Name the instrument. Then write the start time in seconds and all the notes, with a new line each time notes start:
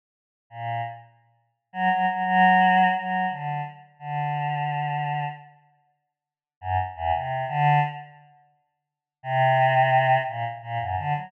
choir aahs
0.50 A#2
1.73 F#3
1.90 F#3
2.07 F#3
2.25 F#3
2.95 F#3
3.30 D3
3.99 D3
6.61 F#2
6.96 E2
7.13 C3
7.48 D3
9.23 C3
10.28 A#2
10.62 A#2
10.80 F#2
10.97 D3
11.15 F#3